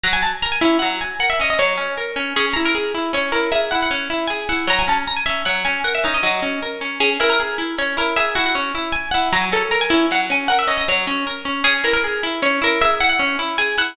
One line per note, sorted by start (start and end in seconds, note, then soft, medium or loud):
0.03 0.21 F#3 loud
0.03 0.13 A#5 medium
0.13 0.22 G#5 medium
0.23 0.32 A5 medium
0.42 0.60 A#4 medium
0.42 0.52 A#5 medium
0.52 0.61 G#5 medium
0.61 0.79 C#4 medium
0.61 0.78 E4 medium
0.79 0.99 F#3 medium
0.79 0.88 F#5 medium
1.01 1.17 G#5 medium
1.20 1.37 A#4 medium
1.20 1.29 F#5 medium
1.30 1.39 E5 medium
1.40 1.57 C#4 medium
1.40 1.50 D#5 medium
1.50 1.59 D#5 medium
1.59 1.76 F#3 medium
1.59 2.12 C#5 medium
1.78 1.95 C#4 medium
1.98 2.15 A#4 medium
2.16 2.33 C#4 medium
2.36 2.54 C#4 loud
2.36 2.45 G#4 medium
2.53 2.74 E4 medium
2.53 2.63 A#5 medium
2.65 2.75 A#4 medium
2.75 2.92 G#4 medium
2.95 3.12 E4 medium
3.13 3.31 C#4 loud
3.13 3.33 C#5 medium
3.32 3.50 E4 medium
3.32 3.50 A#4 medium
3.52 3.70 G#4 medium
3.52 3.61 E5 medium
3.71 3.89 E4 medium
3.71 3.80 F#5 medium
3.83 3.92 F#5 medium
3.91 4.08 C#4 medium
4.10 4.27 E4 medium
4.27 4.48 G#4 medium
4.27 4.44 G#5 medium
4.49 4.66 E4 medium
4.49 4.66 F#5 medium
4.67 4.85 F#3 loud
4.67 4.79 A#5 medium
4.79 4.88 G#5 medium
4.88 5.05 C#4 medium
4.88 4.98 A5 medium
5.08 5.17 A#5 medium
5.16 5.26 G#5 medium
5.26 5.44 C#4 medium
5.26 5.42 E5 medium
5.45 5.63 F#3 medium
5.45 5.55 F#5 medium
5.65 5.83 C#4 medium
5.65 5.80 G#5 medium
5.84 6.02 A#4 medium
5.84 5.93 F#5 medium
5.95 6.04 E5 medium
6.04 6.21 C#4 medium
6.04 6.14 D#4 medium
6.14 6.23 D#5 medium
6.23 6.40 F#3 medium
6.23 6.76 D#5 medium
6.43 6.60 C#4 medium
6.62 6.80 A#4 medium
6.81 6.99 C#4 medium
7.00 7.18 C#4 loud
7.00 7.10 G#4 medium
7.20 7.37 E4 medium
7.20 7.29 A#4 medium
7.30 7.39 A#4 medium
7.40 7.57 G#4 medium
7.58 7.76 E4 medium
7.78 7.96 C#4 medium
7.78 7.97 C#5 medium
7.97 8.14 E4 medium
7.97 8.17 A#4 medium
8.16 8.34 G#4 medium
8.16 8.26 E5 medium
8.35 8.54 E4 medium
8.35 8.44 F#4 medium
8.46 8.55 F#5 medium
8.55 8.73 C#4 medium
8.75 8.92 E4 medium
8.92 9.09 G#5 medium
9.11 9.32 E4 medium
9.11 9.28 F#5 medium
9.33 9.50 F#3 loud
9.33 9.42 A#5 medium
9.42 9.51 G#5 medium
9.52 9.70 C#4 medium
9.52 9.62 A4 medium
9.71 9.89 A#4 medium
9.71 9.80 A#5 medium
9.81 9.90 G#5 medium
9.90 10.08 C#4 medium
9.90 10.06 E4 medium
10.11 10.28 F#3 medium
10.11 10.21 F#5 medium
10.30 10.47 C#4 medium
10.30 10.47 G#5 medium
10.48 10.67 A#4 medium
10.48 10.57 F#5 medium
10.59 10.68 E5 medium
10.67 10.85 C#4 medium
10.67 10.77 D#5 medium
10.78 10.87 D#5 medium
10.88 11.06 F#3 medium
10.88 11.41 C#5 medium
11.07 11.25 C#4 medium
11.27 11.44 A#4 medium
11.45 11.63 C#4 medium
11.64 11.82 C#4 loud
11.64 11.73 G#4 medium
11.84 12.01 E4 medium
11.84 11.93 A#4 medium
11.93 12.03 A#4 medium
12.04 12.22 G#4 medium
12.23 12.41 E4 medium
12.42 12.60 C#4 medium
12.42 12.62 C#5 medium
12.62 12.79 E4 loud
12.62 12.82 A#4 medium
12.81 12.99 G#4 medium
12.81 12.91 E5 medium
13.00 13.18 E4 medium
13.00 13.09 F#5 medium
13.09 13.19 F#5 medium
13.19 13.37 C#4 loud
13.39 13.56 E4 medium
13.58 13.76 G#4 loud
13.58 13.75 G#5 medium
13.78 13.95 E4 medium
13.78 13.95 F#5 medium